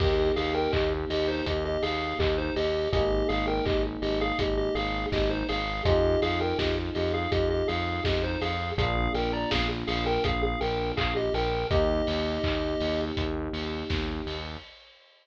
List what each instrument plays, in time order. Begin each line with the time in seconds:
0.00 synth bass 1 D#2, electric piano 1 A#3 D#4 G4, lead 1 (square) G4 D#5, kick, crash
0.36 synth bass 1 D#2, lead 1 (square) G#4 F5, open hi-hat
0.55 lead 1 (square) A#4 G5
0.73 synth bass 1 D#2, lead 1 (square) G4 D#5, kick, clap
1.10 synth bass 1 D#2, lead 1 (square) G4 D#5, open hi-hat
1.28 lead 1 (square) D#4 C5
1.46 synth bass 1 D#2, lead 1 (square) G4 D#5, kick, closed hi-hat
1.65 lead 1 (square) G4 D#5
1.82 synth bass 1 D#2, lead 1 (square) G#4 F5, open hi-hat
2.19 synth bass 1 D#2, lead 1 (square) G4 D#5, kick, clap
2.38 lead 1 (square) D#4 C5
2.56 synth bass 1 D#2, lead 1 (square) G4 D#5, open hi-hat
2.92 synth bass 1 G#1, electric piano 1 A#3 D#4 G#4, lead 1 (square) G4 D#5, kick, closed hi-hat
3.29 synth bass 1 G#1, lead 1 (square) G#4 F5, open hi-hat
3.48 lead 1 (square) A#4 G5
3.66 synth bass 1 G#1, lead 1 (square) G4 D#5, kick, clap
4.02 synth bass 1 G#1, lead 1 (square) G4 D#5, open hi-hat
4.21 lead 1 (square) G#4 F5
4.39 synth bass 1 G#1, lead 1 (square) G4 D#5, kick, closed hi-hat
4.57 lead 1 (square) G4 D#5
4.75 synth bass 1 G#1, lead 1 (square) G#4 F5, open hi-hat
5.12 synth bass 1 G#1, lead 1 (square) G4 D#5, kick, snare
5.30 lead 1 (square) D#4 C5
5.49 synth bass 1 G#1, lead 1 (square) G#4 F5, open hi-hat
5.85 synth bass 1 F2, electric piano 1 C4 D#4 F4 G#4, lead 1 (square) G4 D#5, kick, closed hi-hat
6.22 synth bass 1 F2, lead 1 (square) G#4 F5, open hi-hat
6.41 lead 1 (square) A#4 G5
6.59 synth bass 1 F2, lead 1 (square) G4 D#5, kick, snare
6.95 synth bass 1 F2, lead 1 (square) G4 D#5, open hi-hat
7.14 lead 1 (square) G#4 F5
7.32 synth bass 1 F2, lead 1 (square) G4 D#5, kick, closed hi-hat
7.50 lead 1 (square) G4 D#5
7.68 synth bass 1 F2, lead 1 (square) G#4 F5, open hi-hat
8.04 synth bass 1 F2, lead 1 (square) G4 D#5, kick, snare
8.24 lead 1 (square) D#4 C5
8.41 synth bass 1 F2, lead 1 (square) G#4 F5, open hi-hat
8.77 synth bass 1 A#1, electric piano 1 A#3 D4 F4, lead 1 (square) G#4 F5, kick, closed hi-hat
9.14 synth bass 1 A#1, lead 1 (square) A#4 G5, open hi-hat
9.33 lead 1 (square) D5 A#5
9.51 synth bass 1 A#1, lead 1 (square) G#4 F5, kick, snare
9.87 synth bass 1 A#1, lead 1 (square) G#4 F5, open hi-hat
10.06 lead 1 (square) A#4 G5
10.24 synth bass 1 A#1, lead 1 (square) G#4 F5, kick, closed hi-hat
10.43 lead 1 (square) G#4 F5
10.61 synth bass 1 A#1, lead 1 (square) A#4 G5, open hi-hat
10.97 synth bass 1 A#1, lead 1 (square) G#4 F5, kick, clap
11.16 lead 1 (square) G4 D#5
11.34 synth bass 1 A#1, lead 1 (square) A#4 G5, open hi-hat
11.71 synth bass 1 D#2, electric piano 1 A#3 D#4 G4, lead 1 (square) G4 D#5, kick, closed hi-hat
12.07 synth bass 1 D#2, open hi-hat
12.44 synth bass 1 D#2, kick, clap
12.80 synth bass 1 D#2, open hi-hat
13.17 synth bass 1 D#2, kick, closed hi-hat
13.53 synth bass 1 D#2, open hi-hat
13.90 synth bass 1 D#2, kick, snare
14.26 synth bass 1 D#2, open hi-hat